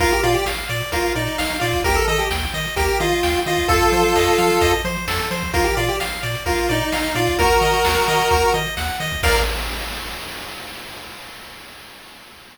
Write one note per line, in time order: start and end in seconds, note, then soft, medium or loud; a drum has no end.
0.00 0.13 A#1 loud
0.00 0.11 F4 loud
0.00 0.21 A#4 loud
0.00 kick medium
0.00 closed hi-hat medium
0.12 0.24 G4 medium
0.12 closed hi-hat medium
0.23 0.36 A#2 medium
0.23 0.34 F4 loud
0.23 0.44 D5 medium
0.23 closed hi-hat medium
0.34 0.45 G4 medium
0.34 closed hi-hat medium
0.46 0.59 A#1 medium
0.46 0.67 F5 medium
0.46 snare loud
0.57 closed hi-hat medium
0.69 0.82 A#2 loud
0.69 0.90 D5 medium
0.69 closed hi-hat medium
0.81 closed hi-hat medium
0.92 1.05 A#1 loud
0.92 1.13 F4 medium
0.92 1.13 A#4 loud
0.92 kick medium
0.92 closed hi-hat loud
1.04 closed hi-hat medium
1.15 1.28 A#2 medium
1.15 1.57 D#4 medium
1.15 1.36 D5 medium
1.15 closed hi-hat medium
1.27 closed hi-hat medium
1.38 1.51 A#1 medium
1.38 1.59 F5 loud
1.38 snare loud
1.50 closed hi-hat medium
1.60 1.74 A#2 loud
1.60 1.81 F4 medium
1.60 1.82 D5 medium
1.60 closed hi-hat medium
1.73 kick medium
1.73 closed hi-hat medium
1.84 1.98 D#2 loud
1.84 1.96 G4 loud
1.84 2.05 A#4 loud
1.84 kick loud
1.84 closed hi-hat medium
1.95 2.06 A4 medium
1.95 closed hi-hat medium
2.07 2.20 D#3 loud
2.07 2.19 A4 medium
2.07 2.28 D#5 loud
2.07 closed hi-hat medium
2.18 2.29 G4 medium
2.18 closed hi-hat medium
2.30 2.43 D#2 loud
2.30 2.52 G5 medium
2.30 snare loud
2.42 kick medium
2.54 2.66 D#3 loud
2.54 2.75 D#5 medium
2.54 closed hi-hat medium
2.65 closed hi-hat medium
2.76 2.90 D#2 medium
2.76 2.99 G4 loud
2.76 2.98 A#4 loud
2.76 kick medium
2.76 closed hi-hat loud
2.89 closed hi-hat medium
3.00 3.13 D#3 loud
3.00 3.40 F4 medium
3.00 3.21 D#5 medium
3.00 closed hi-hat medium
3.12 closed hi-hat medium
3.23 3.36 D#2 medium
3.23 3.44 G5 medium
3.23 snare medium
3.35 closed hi-hat medium
3.46 3.59 D#3 medium
3.46 3.68 F4 medium
3.46 3.67 D#5 medium
3.46 closed hi-hat medium
3.57 kick medium
3.57 closed hi-hat medium
3.68 3.82 F2 loud
3.68 4.72 F4 medium
3.68 4.72 A4 loud
3.68 3.90 A4 loud
3.68 kick loud
3.68 closed hi-hat medium
3.81 closed hi-hat medium
3.92 4.05 F3 medium
3.92 4.13 C5 loud
3.92 closed hi-hat medium
4.15 4.28 F2 loud
4.15 4.36 D#5 medium
4.15 snare medium
4.27 closed hi-hat medium
4.38 4.51 F3 loud
4.38 4.59 F5 medium
4.38 closed hi-hat medium
4.50 closed hi-hat medium
4.61 4.74 F2 loud
4.61 4.82 D#5 loud
4.61 kick medium
4.61 closed hi-hat loud
4.73 closed hi-hat medium
4.84 4.97 F3 loud
4.84 5.05 C5 loud
4.84 closed hi-hat medium
4.96 closed hi-hat medium
5.07 5.20 F2 medium
5.07 5.29 A4 medium
5.07 snare loud
5.19 closed hi-hat medium
5.31 5.43 F3 medium
5.31 5.52 C5 medium
5.31 closed hi-hat medium
5.42 kick medium
5.42 closed hi-hat medium
5.53 5.67 A#1 loud
5.53 5.64 F4 medium
5.53 5.75 A#4 loud
5.53 kick loud
5.53 closed hi-hat loud
5.64 5.75 G4 medium
5.64 closed hi-hat medium
5.77 5.89 A#2 medium
5.77 5.88 F4 medium
5.77 5.97 D5 loud
5.77 closed hi-hat medium
5.88 5.99 G4 medium
5.88 closed hi-hat medium
6.00 6.13 A#1 medium
6.00 6.21 F5 medium
6.00 snare medium
6.12 closed hi-hat medium
6.23 6.36 A#2 loud
6.23 6.44 D5 medium
6.23 closed hi-hat medium
6.35 closed hi-hat medium
6.46 6.59 A#1 loud
6.46 6.69 F4 medium
6.46 6.67 A#4 loud
6.46 kick medium
6.46 closed hi-hat medium
6.58 closed hi-hat medium
6.69 6.82 A#2 loud
6.69 7.15 D#4 medium
6.69 6.90 D5 medium
6.69 closed hi-hat medium
6.81 closed hi-hat medium
6.92 7.05 A#1 medium
6.92 7.13 F5 medium
6.92 snare loud
7.04 closed hi-hat medium
7.15 7.28 A#2 loud
7.15 7.36 F4 medium
7.15 7.36 D5 medium
7.15 closed hi-hat medium
7.27 kick medium
7.27 closed hi-hat medium
7.38 7.51 D#2 loud
7.38 8.53 F#4 medium
7.38 7.59 A#4 loud
7.38 8.53 A#4 loud
7.38 kick loud
7.38 closed hi-hat medium
7.50 closed hi-hat medium
7.61 7.74 D#3 medium
7.61 7.82 D#5 medium
7.61 closed hi-hat medium
7.73 closed hi-hat medium
7.84 7.97 D#2 loud
7.84 8.05 F#5 medium
7.84 snare loud
7.96 closed hi-hat medium
8.07 8.21 D#3 loud
8.07 8.29 D#5 medium
8.07 closed hi-hat medium
8.20 closed hi-hat medium
8.31 8.44 D#2 medium
8.31 8.52 A#4 loud
8.31 kick medium
8.31 closed hi-hat medium
8.42 closed hi-hat medium
8.54 8.67 D#3 loud
8.54 8.75 D#5 medium
8.54 closed hi-hat medium
8.66 closed hi-hat medium
8.77 8.90 D#2 medium
8.77 8.98 F#5 medium
8.77 snare medium
8.88 closed hi-hat medium
9.00 9.13 D#3 medium
9.00 9.21 D#5 medium
9.00 closed hi-hat medium
9.12 kick medium
9.12 closed hi-hat medium
9.23 9.40 A#1 loud
9.23 9.39 A#4 loud
9.23 9.39 D5 medium
9.23 9.39 F5 loud
9.23 kick loud
9.23 crash loud